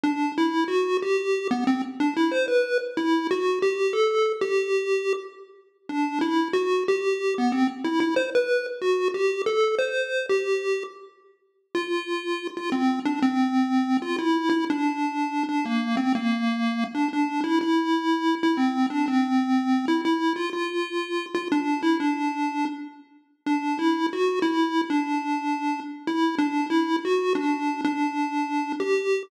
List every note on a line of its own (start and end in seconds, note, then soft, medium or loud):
0.04 0.32 D4 loud
0.38 0.64 E4 medium
0.68 0.97 F#4 loud
1.02 1.48 G4 loud
1.51 1.64 B3 loud
1.67 1.82 C4 loud
2.00 2.14 D4 loud
2.17 2.31 E4 loud
2.32 2.46 C5 medium
2.48 2.78 B4 medium
2.97 3.27 E4 loud
3.31 3.59 F#4 medium
3.62 3.93 G4 loud
3.93 4.32 A4 medium
4.41 5.13 G4 loud
5.89 6.19 D4 loud
6.21 6.48 E4 medium
6.53 6.84 F#4 loud
6.88 7.34 G4 loud
7.38 7.52 B3 loud
7.52 7.67 C4 loud
7.84 8.00 E4 loud
8.00 8.15 E4 medium
8.16 8.30 C5 medium
8.35 8.66 B4 medium
8.82 9.08 F#4 loud
9.14 9.42 G4 loud
9.46 9.75 A4 medium
9.79 10.26 C5 medium
10.29 10.83 G4 medium
11.75 12.47 F4 loud
12.57 12.70 F4 loud
12.72 13.00 C4 loud
13.05 13.20 D4 medium
13.22 13.97 C4 loud
14.02 14.16 F4 loud
14.18 14.49 E4 loud
14.50 14.65 E4 loud
14.70 15.43 D4 loud
15.49 15.65 D4 loud
15.66 15.96 A#3 medium
15.97 16.13 C4 loud
16.15 16.84 A#3 loud
16.95 17.08 D4 loud
17.13 17.41 D4 loud
17.44 17.59 E4 loud
17.61 18.35 E4 loud
18.43 18.57 E4 loud
18.57 18.86 C4 medium
18.90 19.06 D4 loud
19.08 19.86 C4 loud
19.88 20.01 E4 loud
20.05 20.33 E4 medium
20.36 20.50 F4 loud
20.53 21.26 F4 loud
21.35 21.48 F4 loud
21.52 21.81 D4 loud
21.83 21.98 E4 loud
22.00 22.65 D4 loud
23.46 23.78 D4 loud
23.79 24.07 E4 loud
24.13 24.39 F#4 loud
24.42 24.81 E4 loud
24.90 25.80 D4 loud
26.07 26.35 E4 medium
26.38 26.66 D4 loud
26.70 26.96 E4 loud
27.05 27.33 F#4 loud
27.35 27.81 D4 loud
27.85 28.72 D4 loud
28.80 29.23 G4 loud